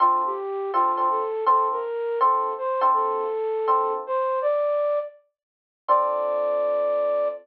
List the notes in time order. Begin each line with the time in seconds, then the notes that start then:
0.00 D3 C4 F4 A4
0.26 G4
0.73 D3 C4 F4 A4
0.97 D3 C4 F4 A4
1.10 A4
1.46 D3 C4 F4 A4
1.71 A#4
2.21 D3 C4 F4 A4
2.58 C5
2.81 D3 C4 F4 A4
2.94 A4
3.68 D3 C4 F4 A4
4.07 C5
4.42 D5
5.88 D3 C4 F4 A4 D5